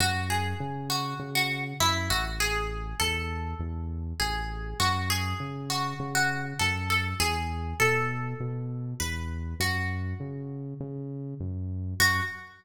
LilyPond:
<<
  \new Staff \with { instrumentName = "Acoustic Guitar (steel)" } { \time 4/4 \key fis \minor \tempo 4 = 100 fis'8 gis'4 fis'8. fis'8 r16 e'8 fis'16 r16 | gis'4 a'2 gis'4 | fis'8 gis'4 fis'8. fis'8 r16 a'8 a'16 r16 | gis'4 a'2 b'4 |
fis'2 r2 | fis'4 r2. | }
  \new Staff \with { instrumentName = "Synth Bass 1" } { \clef bass \time 4/4 \key fis \minor fis,4 cis4 cis4 fis,8 a,,8~ | a,,4 e,4 e,4 a,,4 | fis,4 cis4 cis4 fis,4 | e,4 b,4 b,4 e,4 |
fis,4 cis4 cis4 fis,4 | fis,4 r2. | }
>>